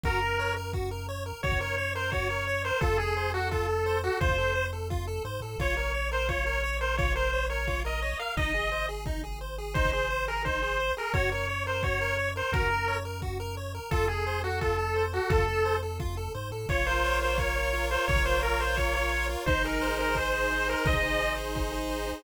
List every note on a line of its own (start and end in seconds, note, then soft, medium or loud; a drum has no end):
0.04 1.33 F#2 loud
0.04 0.20 F#4 medium
0.04 0.53 A#4 loud
0.04 kick loud
0.22 0.38 A#4 medium
0.39 0.55 C#5 medium
0.57 0.72 A#4 medium
0.73 0.90 F#4 medium
0.73 kick medium
0.91 1.07 A#4 medium
1.09 1.24 C#5 medium
1.26 1.41 A#4 medium
1.43 2.72 F#2 medium
1.43 1.59 F#4 medium
1.43 1.59 C#5 loud
1.43 kick medium
1.52 kick medium
1.61 1.76 A#4 medium
1.61 1.92 C#5 medium
1.78 1.94 C#5 medium
1.95 2.11 A#4 medium
1.95 2.10 C5 medium
2.12 2.28 F#4 medium
2.12 2.63 C#5 medium
2.12 kick medium
2.30 2.46 A#4 medium
2.47 2.63 C#5 medium
2.65 2.80 A#4 medium
2.65 2.80 C5 medium
2.81 4.10 F2 loud
2.81 2.98 F4 medium
2.81 2.97 A4 medium
2.81 kick loud
2.98 3.30 G#4 medium
2.98 3.15 A4 medium
3.17 3.32 C5 medium
3.34 3.48 F#4 medium
3.34 3.50 A4 medium
3.51 3.67 F4 medium
3.51 3.97 A4 medium
3.51 kick medium
3.69 3.84 A4 medium
3.86 4.02 C5 medium
4.03 4.18 F#4 medium
4.03 4.19 A4 medium
4.21 5.20 F2 medium
4.21 4.36 F4 medium
4.21 4.65 C5 medium
4.21 kick loud
4.29 kick medium
4.38 4.54 A4 medium
4.55 4.71 C5 medium
4.73 4.88 A4 medium
4.90 5.06 F4 medium
4.90 kick medium
5.07 5.23 A4 medium
5.25 5.40 G#2 medium
5.25 5.40 C5 medium
5.41 5.56 A2 medium
5.41 5.58 A4 medium
5.58 8.14 A#1 loud
5.58 5.75 F4 medium
5.58 5.77 C#5 medium
5.58 kick medium
5.77 5.92 A#4 medium
5.77 6.09 C#5 medium
5.94 6.10 C#5 medium
6.11 6.27 A#4 medium
6.11 6.28 C5 medium
6.29 6.44 F4 medium
6.29 6.77 C#5 medium
6.29 kick medium
6.46 6.62 A#4 medium
6.64 6.79 C#5 medium
6.81 6.96 A#4 medium
6.81 6.95 C5 medium
6.97 7.14 F4 medium
6.97 7.13 C#5 medium
6.97 kick loud
7.05 kick medium
7.16 7.31 A#4 medium
7.16 7.45 C5 medium
7.33 7.48 C#5 medium
7.50 7.66 A#4 medium
7.50 7.80 C#5 medium
7.67 7.83 F4 medium
7.67 kick medium
7.85 8.01 A#4 medium
7.85 8.18 D#5 medium
8.02 8.18 C#5 medium
8.19 8.35 A#4 medium
8.19 8.34 F5 medium
8.37 10.92 G#1 loud
8.37 8.53 D#4 medium
8.37 8.86 D#5 loud
8.37 kick loud
8.54 8.70 G#4 medium
8.72 8.87 C5 medium
8.89 9.04 G#4 medium
9.06 9.22 D#4 medium
9.06 kick medium
9.24 9.39 G#4 medium
9.41 9.56 C5 medium
9.58 9.74 G#4 medium
9.74 9.91 D#4 medium
9.74 9.90 C5 medium
9.74 kick loud
9.85 kick medium
9.92 10.09 G#4 medium
9.92 10.26 C5 medium
10.10 10.26 C5 medium
10.28 10.43 G#4 medium
10.28 10.43 A#4 medium
10.45 10.61 D#4 medium
10.45 10.92 C5 medium
10.45 kick medium
10.62 10.78 G#4 medium
10.80 10.95 C5 medium
10.97 11.13 G#4 medium
10.97 11.13 A#4 medium
11.14 12.42 F#2 loud
11.14 11.30 F#4 medium
11.14 11.30 C#5 loud
11.14 kick loud
11.32 11.47 A#4 medium
11.32 11.64 C#5 medium
11.49 11.65 C#5 medium
11.66 11.82 A#4 medium
11.66 11.83 C5 medium
11.83 11.99 F#4 medium
11.83 12.29 C#5 medium
11.83 kick medium
12.01 12.17 A#4 medium
12.18 12.34 C#5 medium
12.36 12.51 A#4 medium
12.36 12.53 C5 medium
12.52 13.80 F#2 loud
12.52 12.69 F#4 medium
12.52 12.95 A#4 loud
12.52 kick loud
12.62 kick medium
12.70 12.86 A#4 medium
12.88 13.03 C#5 medium
13.05 13.21 A#4 medium
13.22 13.38 F#4 medium
13.22 kick medium
13.40 13.55 A#4 medium
13.57 13.73 C#5 medium
13.75 13.90 A#4 medium
13.91 15.20 F2 loud
13.91 14.08 F4 loud
13.91 14.05 A4 loud
13.91 kick loud
14.08 14.40 G#4 medium
14.08 14.25 A4 medium
14.27 14.42 C5 medium
14.44 14.60 F#4 medium
14.44 14.59 A4 medium
14.61 14.77 F4 medium
14.61 15.03 A4 medium
14.61 kick medium
14.79 14.94 A4 medium
14.96 15.11 C5 medium
15.13 15.31 F#4 medium
15.13 15.29 A4 medium
15.30 16.29 F2 medium
15.30 15.46 F4 medium
15.30 15.75 A4 loud
15.30 kick loud
15.38 kick medium
15.48 15.63 A4 medium
15.65 15.81 C5 medium
15.83 15.98 A4 medium
16.00 16.15 F4 medium
16.00 kick medium
16.17 16.33 A4 medium
16.35 16.51 G#2 medium
16.35 16.50 C5 medium
16.51 16.66 A2 medium
16.51 16.67 A4 medium
16.69 17.97 A#1 medium
16.69 17.21 F4 medium
16.69 16.86 C#5 loud
16.69 kick loud
16.86 17.38 A#4 medium
16.86 17.19 C5 medium
17.04 17.55 C#5 medium
17.21 17.73 F4 medium
17.21 17.37 C5 medium
17.38 17.90 A#4 medium
17.38 17.86 C#5 medium
17.38 kick medium
17.56 18.08 C#5 medium
17.73 18.25 F4 medium
17.91 18.42 A#4 medium
17.91 18.05 C5 loud
18.08 19.36 A#1 loud
18.08 18.23 C#5 loud
18.08 18.60 C#5 medium
18.08 kick loud
18.16 kick medium
18.25 18.77 F4 medium
18.25 18.41 C5 medium
18.43 18.60 A#4 medium
18.43 18.94 A#4 medium
18.60 18.76 C5 medium
18.60 19.11 C#5 medium
18.77 19.29 F4 medium
18.77 18.93 C#5 medium
18.77 kick medium
18.94 19.44 A#4 medium
18.94 19.26 C#5 medium
19.12 19.45 C#5 medium
19.29 19.46 F4 medium
19.46 20.74 G#1 loud
19.46 19.98 D#4 loud
19.46 19.63 C5 loud
19.46 kick loud
19.64 20.16 G#4 medium
19.64 19.96 A#4 medium
19.81 20.33 C5 medium
19.99 20.50 D#4 medium
19.99 20.15 A#4 medium
20.15 20.68 G#4 medium
20.15 20.68 C5 medium
20.15 kick medium
20.33 20.85 C5 medium
20.51 21.02 D#4 medium
20.68 21.20 G#4 medium
20.68 20.86 A#4 medium
20.85 22.12 G#1 medium
20.85 21.37 C5 medium
20.85 21.33 D#5 loud
20.85 kick loud
20.93 kick medium
21.03 21.54 D#4 medium
21.20 21.72 G#4 medium
21.38 21.89 C5 medium
21.55 22.06 D#4 medium
21.55 kick medium
21.72 22.22 G#4 medium
21.90 22.22 C5 medium
22.07 22.23 D#4 medium